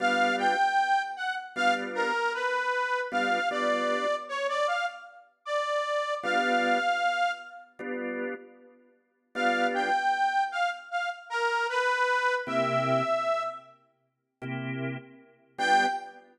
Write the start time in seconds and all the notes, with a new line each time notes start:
0.00 G3 B3 D4 F4 F5
0.39 G5
1.16 F#5
1.56 G3 B3 D4 F4 F5
1.95 A#4
2.34 B4
3.12 G3 B3 D4 F4 F5
3.51 G3 B3 D4 F4 D5
4.29 C#5
4.48 D5
4.67 F5
5.45 D5
6.23 G3 B3 D4 F4 F5
7.79 G3 B3 D4 F4
9.35 G3 B3 D4 F4 F5
9.74 G5
10.52 F5
10.91 F5
11.30 A#4
11.69 B4
12.47 C3 A#3 E4 G4 E5
14.42 C3 A#3 E4 G4
15.58 G3 B3 D4 F4 G5